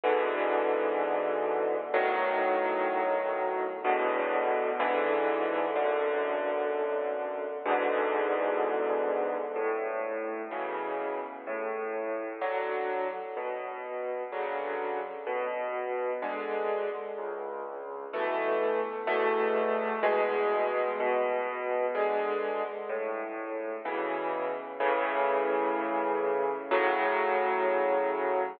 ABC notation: X:1
M:4/4
L:1/8
Q:1/4=63
K:A
V:1 name="Acoustic Grand Piano"
[G,,B,,D,E,]4 | [B,,,A,,^D,F,]4 [E,,A,,B,,=D,]2 [B,,,G,,D,E,]2 | [B,,,F,,D,]4 [E,,G,,B,,D,]4 | A,,2 [B,,C,E,]2 A,,2 [D,F,]2 |
B,,2 [C,D,F,]2 B,,2 [D,G,]2 | C,,2 [B,,E,A,]2 [E,,B,,A,]2 [E,,B,,G,]2 | B,,2 [D,G,]2 A,,2 [B,,C,E,]2 | [A,,C,E,]4 [A,,C,F,]4 |]